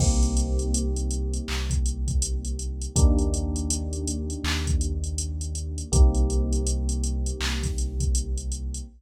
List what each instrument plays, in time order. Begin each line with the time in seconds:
0.00 synth bass 2 C2, electric piano 1 A#3 C4 D#4 G4, kick, crash
0.23 closed hi-hat
0.37 closed hi-hat
0.59 closed hi-hat
0.74 closed hi-hat
0.96 closed hi-hat
1.11 closed hi-hat
1.33 closed hi-hat
1.48 synth bass 2 C2, clap
1.70 kick, closed hi-hat
1.86 closed hi-hat
2.08 kick, closed hi-hat
2.22 closed hi-hat
2.45 closed hi-hat
2.59 closed hi-hat
2.81 closed hi-hat
2.96 synth bass 2 D#2, electric piano 1 A#3 D4 D#4 G4, kick, closed hi-hat
3.19 closed hi-hat
3.34 closed hi-hat
3.56 closed hi-hat
3.70 closed hi-hat
3.93 closed hi-hat
4.07 closed hi-hat
4.30 closed hi-hat
4.44 synth bass 2 D#2, clap
4.67 kick, closed hi-hat
4.81 closed hi-hat
5.04 closed hi-hat
5.18 closed hi-hat
5.41 closed hi-hat
5.55 closed hi-hat
5.78 closed hi-hat
5.92 synth bass 2 C2, electric piano 1 A#3 C4 D#4 G4, kick, closed hi-hat
6.15 closed hi-hat
6.30 closed hi-hat
6.53 closed hi-hat
6.67 closed hi-hat
6.89 closed hi-hat
7.04 closed hi-hat
7.26 closed hi-hat
7.40 synth bass 2 C2, clap
7.63 kick, snare, closed hi-hat
7.78 closed hi-hat
8.00 kick, closed hi-hat
8.15 closed hi-hat
8.38 closed hi-hat
8.52 closed hi-hat
8.74 closed hi-hat